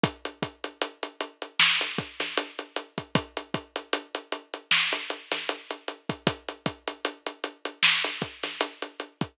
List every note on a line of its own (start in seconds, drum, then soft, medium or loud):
0.04 kick loud
0.04 closed hi-hat loud
0.25 closed hi-hat medium
0.43 kick medium
0.43 closed hi-hat medium
0.64 closed hi-hat medium
0.81 closed hi-hat medium
1.03 closed hi-hat medium
1.20 closed hi-hat medium
1.42 closed hi-hat medium
1.59 snare loud
1.81 closed hi-hat medium
1.98 kick medium
1.98 closed hi-hat medium
2.20 snare medium
2.20 closed hi-hat medium
2.37 closed hi-hat loud
2.59 closed hi-hat medium
2.76 closed hi-hat medium
2.98 kick medium
2.98 closed hi-hat medium
3.15 kick loud
3.15 closed hi-hat loud
3.37 closed hi-hat medium
3.54 kick medium
3.54 closed hi-hat medium
3.76 closed hi-hat medium
3.93 closed hi-hat loud
4.15 closed hi-hat medium
4.32 closed hi-hat medium
4.54 closed hi-hat medium
4.71 snare loud
4.93 closed hi-hat medium
5.10 closed hi-hat medium
5.31 snare medium
5.31 closed hi-hat medium
5.49 closed hi-hat medium
5.70 closed hi-hat medium
5.88 closed hi-hat medium
6.09 kick medium
6.09 closed hi-hat medium
6.27 kick loud
6.27 closed hi-hat loud
6.49 closed hi-hat medium
6.66 kick medium
6.66 closed hi-hat medium
6.88 closed hi-hat medium
7.05 closed hi-hat medium
7.26 closed hi-hat medium
7.44 closed hi-hat medium
7.65 closed hi-hat medium
7.83 snare loud
8.04 closed hi-hat medium
8.22 kick medium
8.22 closed hi-hat medium
8.43 snare medium
8.43 closed hi-hat medium
8.61 closed hi-hat loud
8.82 closed hi-hat medium
9.00 closed hi-hat medium
9.21 kick medium
9.21 closed hi-hat medium